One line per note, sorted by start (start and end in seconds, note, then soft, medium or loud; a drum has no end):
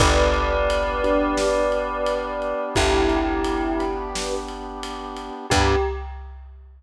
0.00 2.54 G1 medium
0.00 5.46 B3 medium
0.00 0.55 D4 loud
0.00 5.46 D4 medium
0.00 0.55 G4 loud
0.00 5.46 G4 medium
0.00 0.55 B4 loud
0.00 2.63 B4 medium
0.00 2.63 D5 loud
0.00 kick loud
0.00 ride loud
0.34 ride medium
0.70 ride loud
1.04 1.59 D4 medium
1.04 1.59 G4 medium
1.04 1.59 B4 medium
1.04 ride medium
1.37 snare loud
1.72 ride medium
2.06 ride medium
2.42 ride medium
2.75 5.30 G1 medium
2.75 3.71 E4 medium
2.75 3.71 G4 loud
2.75 kick medium
2.75 ride loud
3.09 ride medium
3.44 ride medium
3.79 4.34 D4 medium
3.79 4.34 G4 medium
3.79 4.34 B4 medium
3.79 ride medium
4.15 snare loud
4.48 ride medium
4.83 ride loud
5.17 ride medium
5.50 5.75 G2 medium
5.50 5.76 B3 medium
5.50 5.76 D4 loud
5.50 5.74 G4 loud
5.50 5.76 G4 medium
5.50 5.76 G4 loud
5.50 5.76 B4 loud
5.50 kick loud
5.50 crash loud